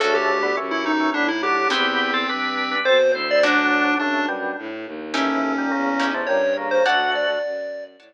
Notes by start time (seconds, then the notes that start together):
0.00 D2 C#3 A3 C#4 D4 F#4 A4
0.15 G4
0.43 D3 B3
0.57 F#2 E3 C#4
0.71 E4
0.86 D#4
1.00 E3 C#4
1.14 A2 D3 B3 D4
1.28 E4
1.43 F#3 D4 G4
1.70 E2 B3 C4 E4 G4
2.14 C4 A4
2.29 G2 D4 B4
2.71 D4 B4
2.85 B2 C4 A4 C5
3.13 D2 E4 C5
3.31 D5
3.43 F#3 A3 C#4 D4 F#4
3.99 F#2 C#3 A3 D4
4.28 B2 G3
4.58 A2
4.86 D#2
5.14 A2 E3 C#4 D#4 E4 G4
5.58 A#2 G3
5.71 E2 C#3 A#3
6.00 C#4 D#4 E4 G4
6.14 C3 A3
6.26 G2 A#2 G3 C#5
6.57 C#3 A#3
6.71 C5
6.85 D2 A3 F#4 C#5 D5 F#5 A5
7.15 D5
7.45 F#2
7.99 A2 C#5 D5 F#5 A5